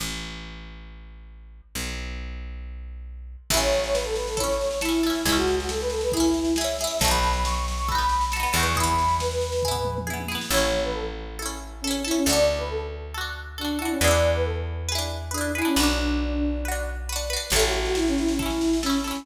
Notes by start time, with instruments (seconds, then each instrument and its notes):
0.00 electric bass (finger) A1
1.75 electric bass (finger) B1
3.50 electric bass (finger) A1, pizzicato strings E4 A4, flute E5, kick, snare, crash
3.57 pizzicato strings C#4
3.61 flute C#5, snare
3.72 snare
3.84 flute C#5, snare
3.93 flute B4, snare
4.04 flute A4, snare
4.16 flute B4, snare
4.27 flute A4, snare
4.37 pizzicato strings E4 A4, flute C#5, kick, snare
4.44 pizzicato strings C#4
4.49 snare
4.61 snare
4.71 snare
4.81 flute E4, pizzicato strings A4, snare
4.85 pizzicato strings C#4 E4
4.93 snare
5.03 flute E4, pizzicato strings E4 A4, snare
5.10 pizzicato strings C#4
5.15 snare
5.25 electric bass (finger) C#2, flute E4, pizzicato strings E4 G#4, kick, snare
5.32 pizzicato strings C#4, flute F#4
5.37 snare
5.47 snare
5.58 flute F#4, snare
5.68 flute A4, snare
5.81 flute B4, snare
5.90 flute A4, snare
6.01 flute B4, snare
6.12 flute E4, pizzicato strings G#4, kick, snare
6.17 pizzicato strings C#4 E4
6.24 snare
6.34 snare
6.45 snare
6.56 pizzicato strings G#4, flute E5, snare
6.61 pizzicato strings C#4 E4
6.68 snare
6.78 pizzicato strings G#4, flute E5, snare
6.84 pizzicato strings C#4 E4
6.90 snare
6.99 electric bass (finger) B1, pizzicato strings A4, flute A5, kick, snare
7.05 pizzicato strings D#4 F#4
7.11 pizzicato strings B3, flute B5, snare
7.23 snare
7.33 flute B5, snare
7.44 flute C#6, snare
7.55 flute C#6, snare
7.66 flute C#6, snare
7.77 flute C#6, snare
7.88 pizzicato strings F#4 A4, flute B5, kick, snare
7.95 pizzicato strings B3 D#4
7.99 snare
8.09 snare
8.21 snare
8.32 pizzicato strings A4, flute B5, snare
8.36 pizzicato strings D#4 F#4
8.43 pizzicato strings B3, snare
8.53 electric bass (finger) E2, pizzicato strings F#4 A4, flute C#6, snare
8.59 pizzicato strings B3 D#4
8.65 snare
8.75 pizzicato strings G#4, flute B5, kick, snare
8.80 pizzicato strings B3 E4
8.86 snare
8.98 snare
9.08 snare
9.20 flute B4, snare
9.31 snare
9.41 snare
9.52 snare
9.62 pizzicato strings G#4, kick, floor tom
9.68 pizzicato strings B3 E4
9.75 floor tom
9.85 mid tom
9.98 mid tom
10.07 pizzicato strings E4 G#4, high tom
10.13 pizzicato strings B3
10.20 high tom
10.28 pizzicato strings E4 G#4, snare
10.35 pizzicato strings B3
10.41 snare
10.50 electric bass (finger) A1, pizzicato strings A4, flute C#5
10.54 pizzicato strings C#4 E4
10.84 flute B4
10.94 flute A4
11.39 pizzicato strings E4 A4
11.46 pizzicato strings C#4
11.81 flute C#4, pizzicato strings A4
11.87 pizzicato strings C#4 E4
12.04 flute E4, pizzicato strings E4 A4
12.11 pizzicato strings C#4
12.16 flute C#4
12.26 electric bass (finger) D2, pizzicato strings F#4 A4, flute D5
12.33 pizzicato strings D4
12.58 flute B4
12.70 flute A4
13.14 pizzicato strings F#4 A4
13.21 pizzicato strings D4
13.58 flute D4, pizzicato strings F#4 A4
13.65 pizzicato strings D4
13.79 flute E4, pizzicato strings F#4 A4
13.85 pizzicato strings D4
13.91 flute C#4
14.00 electric bass (finger) E2, pizzicato strings B4, flute D5
14.04 pizzicato strings E4 G#4
14.11 pizzicato strings D4
14.35 flute B4
14.45 flute A4
14.89 pizzicato strings G#4 B4
14.95 pizzicato strings D4 E4
15.31 flute D4, pizzicato strings G#4 B4
15.38 pizzicato strings D4 E4
15.55 flute E4, pizzicato strings G#4 B4
15.62 flute C#4, pizzicato strings D4 E4
15.76 electric bass (finger) B1, flute D4, pizzicato strings F#4 B4
15.83 pizzicato strings D4
16.65 pizzicato strings F#4 B4
16.72 pizzicato strings D4
17.09 pizzicato strings F#4 B4
17.16 pizzicato strings D4
17.30 pizzicato strings F#4 B4
17.36 pizzicato strings D4
17.50 electric bass (finger) A1, flute A4, pizzicato strings A4, kick, snare, crash
17.56 pizzicato strings C#4 E4
17.62 flute F#4, snare
17.72 snare
17.85 flute F#4, snare
17.95 flute E4, snare
18.07 flute C#4, snare
18.17 flute E4, snare
18.28 flute C#4, snare
18.39 flute E4, pizzicato strings E4 A4, kick, snare
18.46 pizzicato strings C#4
18.50 snare
18.61 snare
18.73 snare
18.83 flute C#4, pizzicato strings E4 A4, snare
18.90 pizzicato strings C#4, snare
19.04 flute C#4, pizzicato strings E4 A4, snare
19.11 pizzicato strings C#4
19.15 snare